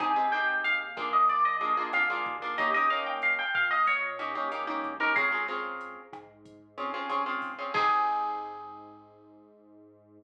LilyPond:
<<
  \new Staff \with { instrumentName = "Acoustic Guitar (steel)" } { \time 4/4 \key aes \major \tempo 4 = 93 aes''8 g''8 f''8 r16 ees''16 d''16 ees''16 ees''16 r16 f''4 | ees''16 ees''16 f''16 g''16 f''16 g''16 f''16 ees''16 des''4 r8. bes'16 | aes'4. r2 r8 | aes'1 | }
  \new Staff \with { instrumentName = "Acoustic Guitar (steel)" } { \time 4/4 \key aes \major <c' ees' g' aes'>16 <c' ees' g' aes'>16 <c' ees' g' aes'>4 <bes d' f' aes'>4 <bes d' f' aes'>16 <bes d' f' aes'>16 <bes d' f' aes'>16 <bes d' f' aes'>8 <bes d' f' aes'>16 | <bes des' ees' g'>16 <bes des' ees' g'>16 <bes des' ees' g'>2 <bes des' ees' g'>16 <bes des' ees' g'>16 <bes des' ees' g'>16 <bes des' ees' g'>8 <bes des' ees' g'>16 | <c' des' f' aes'>16 <c' des' f' aes'>16 <c' des' f' aes'>2 <c' des' f' aes'>16 <c' des' f' aes'>16 <c' des' f' aes'>16 <c' des' f' aes'>8 <c' des' f' aes'>16 | <c' ees' g' aes'>1 | }
  \new Staff \with { instrumentName = "Synth Bass 1" } { \clef bass \time 4/4 \key aes \major aes,,4 ees,4 bes,,4 f,8 ees,8~ | ees,4. bes,4. des,4 | des,4. aes,4. aes,,4 | aes,1 | }
  \new DrumStaff \with { instrumentName = "Drums" } \drummode { \time 4/4 <hh bd ss>8 <hh sn>8 hh8 <hh bd ss>8 <hh bd>8 hh8 <hh ss>8 <hh bd>8 | <hh bd>8 <hh sn>8 <hh ss>8 <hh bd>8 <hh bd>8 <hh ss>8 hh8 <hh bd>8 | <hh bd ss>8 <hh sn>8 hh8 <hh bd ss>8 <hh bd>8 hh8 <hh ss>8 <hho bd>8 | <cymc bd>4 r4 r4 r4 | }
>>